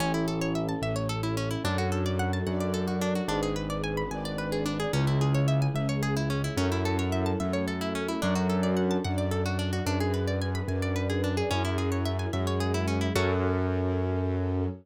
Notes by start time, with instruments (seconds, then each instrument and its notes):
0.00 acoustic grand piano A1, orchestral harp C#4, string ensemble 1 C#4 E4 A4
0.14 orchestral harp E4
0.28 orchestral harp A4
0.41 orchestral harp C#5
0.55 orchestral harp E5
0.68 orchestral harp A5
0.82 acoustic grand piano A1, string ensemble 1 A3 C#4 A4, orchestral harp E5
0.96 orchestral harp C#5
1.09 orchestral harp A4
1.23 orchestral harp E4
1.37 orchestral harp C#4
1.50 orchestral harp E4
1.64 acoustic grand piano F#2, string ensemble 1 D4 F#4 A4, orchestral harp D4
1.78 orchestral harp F#4
1.92 orchestral harp A4
2.06 orchestral harp D5
2.19 orchestral harp F#5
2.33 orchestral harp A5
2.46 acoustic grand piano F#2, string ensemble 1 D4 A4 D5, orchestral harp F#5
2.60 orchestral harp D5
2.74 orchestral harp A4
2.87 orchestral harp F#4
3.01 orchestral harp D4
3.15 orchestral harp F#4
3.28 acoustic grand piano G#1, orchestral harp D4, string ensemble 1 D4 G#4 B4
3.43 orchestral harp G#4
3.56 orchestral harp B4
3.70 orchestral harp D5
3.84 orchestral harp G#5
3.97 orchestral harp B5
4.11 acoustic grand piano G#1, string ensemble 1 D4 B4 D5, orchestral harp G#5
4.25 orchestral harp D5
4.38 orchestral harp B4
4.52 orchestral harp G#4
4.66 orchestral harp D4
4.80 orchestral harp G#4
4.93 acoustic grand piano C#2, orchestral harp C#4, string ensemble 1 C#4 E4 G#4
5.07 orchestral harp E4
5.21 orchestral harp G#4
5.34 orchestral harp C#5
5.48 orchestral harp E5
5.62 orchestral harp G#5
5.74 acoustic grand piano C#2, string ensemble 1 G#3 C#4 G#4, orchestral harp E5
5.89 orchestral harp C#5
6.03 orchestral harp G#4
6.16 orchestral harp E4
6.30 orchestral harp C#4
6.44 orchestral harp E4
6.57 acoustic grand piano F#2, string ensemble 1 C#4 E4 A4, orchestral harp C#4
6.72 orchestral harp E4
6.85 orchestral harp A4
6.99 orchestral harp C#5
7.12 orchestral harp E5
7.26 orchestral harp A5
7.39 acoustic grand piano F#2, string ensemble 1 A3 C#4 A4, orchestral harp E5
7.53 orchestral harp C#5
7.67 orchestral harp A4
7.81 orchestral harp E4
7.95 orchestral harp C#4
8.08 orchestral harp E4
8.21 acoustic grand piano F#2, string ensemble 1 D4 F#4 A4, orchestral harp D4
8.35 orchestral harp F#4
8.49 orchestral harp A4
8.63 orchestral harp D5
8.76 orchestral harp F#5
8.91 orchestral harp A5
9.04 acoustic grand piano F#2, string ensemble 1 D4 A4 D5, orchestral harp F#5
9.18 orchestral harp D5
9.31 orchestral harp A4
9.46 orchestral harp F#4
9.59 orchestral harp D4
9.73 orchestral harp F#4
9.86 acoustic grand piano F#2, orchestral harp D4, string ensemble 1 D4 G#4 B4
10.00 orchestral harp G#4
10.14 orchestral harp B4
10.27 orchestral harp D5
10.41 orchestral harp G#5
10.55 orchestral harp B5
10.68 acoustic grand piano F#2, string ensemble 1 D4 B4 D5, orchestral harp G#5
10.82 orchestral harp D5
10.96 orchestral harp B4
11.09 orchestral harp G#4
11.24 orchestral harp D4
11.37 orchestral harp G#4
11.50 acoustic grand piano F#2, orchestral harp C#4, string ensemble 1 C#4 E4 G#4
11.64 orchestral harp E4
11.78 orchestral harp G#4
11.92 orchestral harp C#5
12.05 orchestral harp E5
12.19 orchestral harp G#5
12.33 acoustic grand piano F#2, string ensemble 1 G#3 C#4 G#4, orchestral harp E5
12.47 orchestral harp C#5
12.60 orchestral harp G#4
12.74 orchestral harp E4
12.87 orchestral harp C#4
13.01 orchestral harp E4
13.15 acoustic grand piano F#2, orchestral harp C#4 F#4 A4, string ensemble 1 C#4 F#4 A4